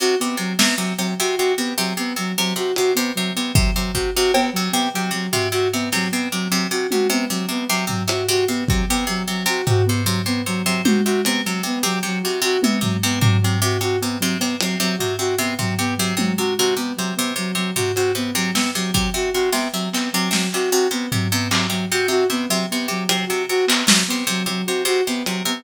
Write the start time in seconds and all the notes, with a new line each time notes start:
0.00 C3 F#4
0.20 C3 B3
0.37 C3 F#3
0.59 C3 B3, snare
0.77 C3 F#3
0.98 C3 F#3, cowbell
1.20 C3 F#4
1.37 C3 F#4
1.57 C3 B3
1.78 C3 F#3
1.97 C3 B3
2.16 C3 F#3
2.37 C3 F#3
2.56 C3 F#4
2.76 C3 F#4, closed hi-hat
2.95 C3 B3
3.15 C3 F#3
3.36 C3 B3
3.55 C3 F#3, kick
3.75 C3 F#3
3.94 C3 F#4, kick
4.16 C3 F#4
4.34 C3 B3, cowbell
4.53 C3 F#3
4.72 C3 B3
4.94 C3 F#3
5.11 C3 F#3
5.32 C3 F#4, floor tom
5.52 C3 F#4
5.73 C3 B3
5.92 C3 F#3, snare
6.12 C3 B3
6.32 C3 F#3
6.50 C3 F#3
6.71 C3 F#4, closed hi-hat
6.91 C3 F#4, high tom
7.10 C3 B3
7.30 C3 F#3
7.49 C3 B3
7.69 C3 F#3
7.87 C3 F#3, floor tom
8.08 C3 F#4, closed hi-hat
8.28 C3 F#4
8.48 C3 B3
8.67 C3 F#3, kick
8.89 C3 B3
9.07 C3 F#3
9.28 C3 F#3
9.46 C3 F#4
9.67 C3 F#4, floor tom
9.86 C3 B3
10.05 C3 F#3
10.26 C3 B3
10.46 C3 F#3
10.66 C3 F#3
10.85 C3 F#4, high tom
11.05 C3 F#4
11.25 C3 B3, closed hi-hat
11.45 C3 F#3
11.63 C3 B3
11.83 C3 F#3
12.03 C3 F#3
12.23 C3 F#4
12.42 C3 F#4
12.61 C3 B3, high tom
12.81 C3 F#3, floor tom
13.03 C3 B3
13.21 C3 F#3, floor tom
13.41 C3 F#3
13.62 C3 F#4
13.81 C3 F#4
14.01 C3 B3
14.19 C3 F#3
14.39 C3 B3, cowbell
14.60 C3 F#3, closed hi-hat
14.80 C3 F#3
14.98 C3 F#4, floor tom
15.19 C3 F#4
15.38 C3 B3
15.59 C3 F#3, floor tom
15.79 C3 B3
15.97 C3 F#3
16.17 C3 F#3, high tom
16.38 C3 F#4
16.58 C3 F#4
16.77 C3 B3
16.97 C3 F#3
17.16 C3 B3
17.36 C3 F#3
17.55 C3 F#3
17.76 C3 F#4, floor tom
17.96 C3 F#4, closed hi-hat
18.15 C3 B3
18.35 C3 F#3
18.54 C3 B3, snare
18.75 C3 F#3
18.94 C3 F#3, kick
19.14 C3 F#4
19.34 C3 F#4
19.52 C3 B3, snare
19.73 C3 F#3
19.93 C3 B3, clap
20.13 C3 F#3
20.31 C3 F#3, snare
20.53 C3 F#4, clap
20.71 C3 F#4
20.91 C3 B3
21.12 C3 F#3, floor tom
21.32 C3 B3
21.51 C3 F#3, clap
21.70 C3 F#3
21.92 C3 F#4
22.08 C3 F#4
22.30 C3 B3
22.49 C3 F#3
22.71 C3 B3
22.88 C3 F#3
23.09 C3 F#3, closed hi-hat
23.27 C3 F#4
23.49 C3 F#4
23.67 C3 B3, clap
23.87 C3 F#3, snare
24.08 C3 B3
24.27 C3 F#3
24.46 C3 F#3, closed hi-hat
24.66 C3 F#4
24.85 C3 F#4
25.07 C3 B3
25.26 C3 F#3, closed hi-hat
25.45 C3 B3